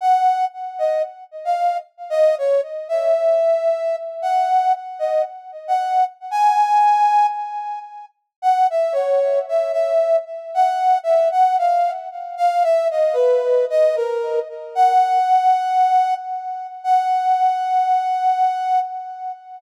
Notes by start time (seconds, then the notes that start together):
0.01 F#5
0.79 D#5
1.45 F5
2.10 D#5
2.38 C#5
2.89 E5
4.22 F#5
4.99 D#5
5.68 F#5
6.31 G#5
8.42 F#5
8.70 E5
8.92 C#5
9.49 E5
9.72 E5
10.54 F#5
11.03 E5
11.32 F#5
11.58 F5
12.37 F5
12.63 E5
12.91 D#5
13.13 B4
13.70 D#5
13.96 A#4
14.75 F#5
16.84 F#5